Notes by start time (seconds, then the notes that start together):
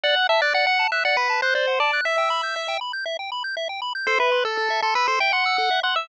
0.03 D5 F#5
0.16 F#5
0.29 E5 A5
0.41 D5 F#6
0.54 D5 F#5
0.67 F#5
0.79 A5
0.92 E5 F#6
1.05 D5 F#5
1.17 B4 F#5
1.30 A5
1.42 C5 F#6
1.55 C5 D5
1.67 F#5
1.80 D5 A5
1.93 F#6
2.05 E5
2.18 G5
2.30 B5
2.43 G6
2.56 E5
2.68 G5
2.81 B5
2.93 G6
3.06 E5
3.19 G5
3.32 B5
3.44 G6
3.57 E5
3.69 G5
3.82 B5
3.95 G6
4.07 A4 C5
4.19 B4 E5
4.32 C6
4.45 A4 E6
4.57 A4
4.70 E5
4.82 A4 C6
4.95 B4 E6
5.08 A4 C5
5.20 E5 G5
5.33 F#5 C6
5.46 E6
5.58 A4
5.71 E5
5.83 F#5 C6
5.96 E5 E6